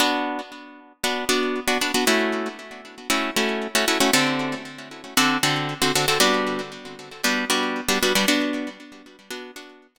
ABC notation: X:1
M:4/4
L:1/16
Q:1/4=116
K:Bm
V:1 name="Acoustic Guitar (steel)"
[B,DF]8 [B,DF]2 [B,DF]3 [B,DF] [B,DF] [B,DF] | [A,CEF]8 [A,CEF]2 [A,CEF]3 [A,CEF] [A,CEF] [A,CEF] | [D,=CGA]8 [D,CFA]2 [D,CFA]3 [D,CFA] [D,CFA] [D,CFA] | [G,B,DF]8 [G,B,DF]2 [G,B,DF]3 [G,B,DF] [G,B,DF] [G,B,DF] |
[B,DF]8 [B,DF]2 [B,DF]3 [B,DF] z2 |]